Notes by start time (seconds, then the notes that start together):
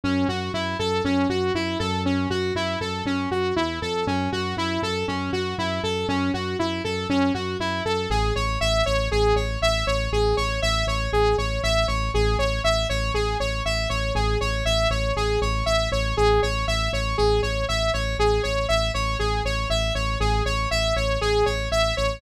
0.04 F#2 C#4
0.28 F#2 F#4
0.54 F#2 E4
0.79 F#2 A4
1.05 F#2 C#4
1.29 F#2 F#4
1.54 F#2 E4
1.79 F#2 A4
2.05 C#4
2.30 F#2 F#4
2.55 F#2 E4
2.81 F#2 A4
3.05 F#2 C#4
3.31 F#2 F#4
3.56 E2 E4
3.82 F2 A4
4.07 F#2 C#4
4.32 F#2 F#4
4.57 F#2 E4
4.82 F#2 A4
5.08 F#2 C#4
5.33 F#2 F#4
5.58 F#2 E4
5.83 F#2 A4
6.08 F#2 C#4
6.34 F#2 F#4
6.59 F#2 E4
6.84 F#2 A4
7.09 F#2 C#4
7.34 F#2 F#4
7.60 F#2 E4
7.85 F#2 A4
8.10 A1 G#4
8.36 A1 C#5
8.61 A1 E5
8.86 A1 C#5
9.11 A1 G#4
9.35 A1 C#5
9.62 A1 E5
9.86 A1 C#5
10.12 A1 G#4
10.37 A1 C#5
10.62 A1 E5
10.87 A1 C#5
11.13 A1 G#4
11.37 A1 C#5
11.63 A1 E5
11.88 A1 C#5
12.14 A1 G#4
12.38 A1 C#5
12.64 A1 E5
12.89 A1 C#5
13.14 A1 G#4
13.40 A1 C#5
13.65 A1 E5
13.89 A1 C#5
14.15 A1 G#4
14.41 A1 C#5
14.65 A1 E5
14.90 A1 C#5
15.16 A1 G#4
15.41 A1 C#5
15.66 A1 E5
15.92 A1 C#5
16.17 A1 G#4
16.42 A1 C#5
16.67 A1 E5
16.93 A1 C#5
17.18 A1 G#4
17.42 A1 C#5
17.68 A1 E5
17.93 A1 C#5
18.18 A1 G#4
18.43 A1 C#5
18.68 A1 E5
18.94 A1 C#5
19.19 A1 G#4
19.44 A1 C#5
19.70 A1 E5
19.95 A1 C#5
20.20 A1 G#4
20.45 A1 C#5
20.71 A1 E5
20.96 A1 C#5
21.21 A1 G#4
21.46 A1 C#5
21.71 A1 E5
21.97 A1 C#5